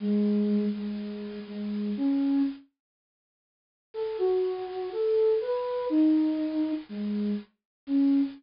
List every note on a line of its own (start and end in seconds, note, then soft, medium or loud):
0.00 0.65 G#3 loud
0.74 1.40 G#3 medium
1.47 1.90 G#3 medium
1.97 2.42 C#4 loud
3.94 4.17 A4 loud
4.18 4.90 F#4 loud
4.92 5.34 A4 loud
5.41 5.86 B4 loud
5.90 6.72 D#4 loud
6.89 7.31 G#3 loud
7.87 8.21 C#4 loud